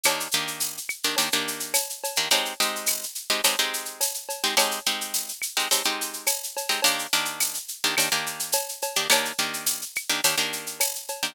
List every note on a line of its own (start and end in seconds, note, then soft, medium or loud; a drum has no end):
0.03 0.28 D#3 loud
0.03 0.28 A#3 loud
0.03 0.28 D4 medium
0.03 0.28 G4 medium
0.03 cowbell loud
0.03 claves loud
0.03 shaker loud
0.20 shaker medium
0.31 0.79 D#3 medium
0.31 0.79 A#3 medium
0.31 0.79 D4 medium
0.31 0.79 G4 medium
0.31 shaker medium
0.47 shaker medium
0.60 tambourine medium
0.60 shaker loud
0.77 shaker medium
0.89 claves medium
0.89 shaker medium
1.03 1.16 D#3 medium
1.03 1.16 A#3 medium
1.03 1.16 D4 medium
1.03 1.16 G4 medium
1.03 shaker medium
1.16 1.29 D#3 medium
1.16 1.29 A#3 medium
1.16 1.29 D4 loud
1.16 1.29 G4 loud
1.16 cowbell medium
1.16 shaker loud
1.32 1.78 D#3 medium
1.32 1.78 A#3 medium
1.32 1.78 D4 loud
1.32 1.78 G4 medium
1.32 shaker medium
1.48 shaker medium
1.60 shaker medium
1.74 tambourine medium
1.74 cowbell medium
1.74 claves medium
1.74 shaker loud
1.90 shaker medium
2.04 cowbell medium
2.04 shaker medium
2.16 2.29 D#3 loud
2.16 2.29 A#3 medium
2.16 2.29 D4 medium
2.16 2.29 G4 medium
2.16 shaker medium
2.30 2.54 G#3 loud
2.30 2.54 C4 loud
2.30 2.54 D#4 loud
2.30 2.54 G4 loud
2.30 cowbell medium
2.30 shaker loud
2.45 shaker medium
2.60 3.05 G#3 medium
2.60 3.05 C4 medium
2.60 3.05 D#4 loud
2.60 3.05 G4 medium
2.60 shaker medium
2.75 shaker medium
2.86 tambourine medium
2.86 claves medium
2.86 shaker loud
3.03 shaker medium
3.15 shaker medium
3.30 3.41 G#3 medium
3.30 3.41 C4 medium
3.30 3.41 D#4 medium
3.30 3.41 G4 loud
3.30 shaker medium
3.44 3.56 G#3 medium
3.44 3.56 C4 medium
3.44 3.56 D#4 medium
3.44 3.56 G4 medium
3.44 cowbell medium
3.44 claves medium
3.44 shaker loud
3.59 4.04 G#3 medium
3.59 4.04 C4 medium
3.59 4.04 D#4 loud
3.59 4.04 G4 medium
3.59 shaker medium
3.73 shaker medium
3.85 shaker medium
4.01 tambourine medium
4.01 cowbell medium
4.01 shaker loud
4.14 shaker medium
4.29 cowbell medium
4.29 shaker medium
4.44 4.55 G#3 medium
4.44 4.55 C4 medium
4.44 4.55 D#4 medium
4.44 4.55 G4 medium
4.44 shaker medium
4.57 4.80 G#3 loud
4.57 4.80 C4 loud
4.57 4.80 D#4 loud
4.57 4.80 G4 loud
4.57 cowbell loud
4.57 claves loud
4.57 shaker loud
4.71 shaker medium
4.86 5.32 G#3 medium
4.86 5.32 C4 medium
4.86 5.32 D#4 medium
4.86 5.32 G4 medium
4.86 shaker medium
5.01 shaker medium
5.14 tambourine medium
5.14 shaker loud
5.28 shaker medium
5.42 claves medium
5.42 shaker medium
5.57 5.68 G#3 medium
5.57 5.68 C4 medium
5.57 5.68 D#4 medium
5.57 5.68 G4 medium
5.57 shaker medium
5.71 5.82 G#3 medium
5.71 5.82 C4 medium
5.71 5.82 D#4 medium
5.71 5.82 G4 medium
5.71 cowbell medium
5.71 shaker loud
5.84 6.31 G#3 medium
5.84 6.31 C4 medium
5.84 6.31 D#4 loud
5.84 6.31 G4 medium
5.84 shaker medium
6.01 shaker medium
6.13 shaker medium
6.26 tambourine medium
6.26 cowbell medium
6.26 claves medium
6.26 shaker loud
6.43 shaker medium
6.57 cowbell medium
6.57 shaker medium
6.69 6.81 G#3 medium
6.69 6.81 C4 medium
6.69 6.81 D#4 medium
6.69 6.81 G4 medium
6.69 shaker medium
6.82 7.07 D#3 loud
6.82 7.07 A#3 loud
6.82 7.07 D4 loud
6.82 7.07 G4 loud
6.82 cowbell medium
6.82 shaker loud
6.99 shaker medium
7.13 7.58 D#3 medium
7.13 7.58 A#3 medium
7.13 7.58 D4 loud
7.13 7.58 G4 loud
7.13 shaker medium
7.25 shaker medium
7.40 tambourine medium
7.40 claves medium
7.40 shaker loud
7.54 shaker medium
7.68 shaker medium
7.84 7.95 D#3 loud
7.84 7.95 A#3 medium
7.84 7.95 D4 medium
7.84 7.95 G4 medium
7.84 shaker medium
7.97 8.09 D#3 medium
7.97 8.09 A#3 medium
7.97 8.09 D4 medium
7.97 8.09 G4 medium
7.97 cowbell medium
7.97 claves medium
7.97 shaker loud
8.12 8.57 D#3 medium
8.12 8.57 A#3 loud
8.12 8.57 D4 medium
8.12 8.57 G4 medium
8.12 shaker medium
8.26 shaker medium
8.39 shaker medium
8.52 tambourine medium
8.52 cowbell loud
8.52 shaker loud
8.69 shaker medium
8.82 cowbell medium
8.82 shaker medium
8.96 9.08 D#3 medium
8.96 9.08 A#3 medium
8.96 9.08 D4 loud
8.96 9.08 G4 medium
8.96 shaker medium
9.10 9.32 D#3 loud
9.10 9.32 A#3 loud
9.10 9.32 D4 medium
9.10 9.32 G4 loud
9.10 cowbell loud
9.10 claves loud
9.10 shaker loud
9.25 shaker medium
9.38 9.84 D#3 medium
9.38 9.84 A#3 medium
9.38 9.84 D4 medium
9.38 9.84 G4 medium
9.38 shaker medium
9.54 shaker medium
9.66 tambourine medium
9.66 shaker loud
9.81 shaker medium
9.95 claves loud
9.95 shaker medium
10.09 10.21 D#3 loud
10.09 10.21 A#3 medium
10.09 10.21 D4 medium
10.09 10.21 G4 medium
10.09 shaker medium
10.24 10.35 D#3 medium
10.24 10.35 A#3 medium
10.24 10.35 D4 medium
10.24 10.35 G4 medium
10.24 cowbell medium
10.24 shaker loud
10.38 10.83 D#3 medium
10.38 10.83 A#3 loud
10.38 10.83 D4 medium
10.38 10.83 G4 medium
10.38 shaker medium
10.53 shaker medium
10.66 shaker medium
10.80 tambourine medium
10.80 cowbell medium
10.80 claves medium
10.80 shaker loud
10.95 shaker medium
11.08 cowbell medium
11.08 shaker medium
11.23 11.34 D#3 medium
11.23 11.34 A#3 medium
11.23 11.34 D4 medium
11.23 11.34 G4 medium
11.23 shaker medium